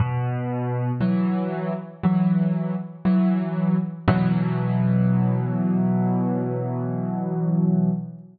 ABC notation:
X:1
M:4/4
L:1/8
Q:1/4=59
K:B
V:1 name="Acoustic Grand Piano" clef=bass
B,,2 [E,F,]2 [E,F,]2 [E,F,]2 | [B,,E,F,]8 |]